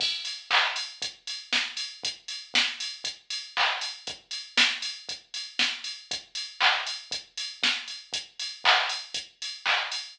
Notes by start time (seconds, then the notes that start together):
0.00 kick, crash
0.25 open hi-hat
0.51 kick, clap
0.76 open hi-hat
1.02 kick, closed hi-hat
1.27 open hi-hat
1.53 kick, snare
1.77 open hi-hat
2.03 kick, closed hi-hat
2.28 open hi-hat
2.54 kick, snare
2.80 open hi-hat
3.04 kick, closed hi-hat
3.30 open hi-hat
3.57 kick, clap
3.81 open hi-hat
4.07 kick, closed hi-hat
4.31 open hi-hat
4.57 kick, snare
4.82 open hi-hat
5.09 kick, closed hi-hat
5.34 open hi-hat
5.59 kick, snare
5.84 open hi-hat
6.11 kick, closed hi-hat
6.35 open hi-hat
6.60 kick, clap
6.87 open hi-hat
7.11 kick, closed hi-hat
7.38 open hi-hat
7.63 kick, snare
7.88 open hi-hat
8.13 kick, closed hi-hat
8.40 open hi-hat
8.64 kick, clap
8.89 open hi-hat
9.14 kick, closed hi-hat
9.42 open hi-hat
9.66 kick, clap
9.92 open hi-hat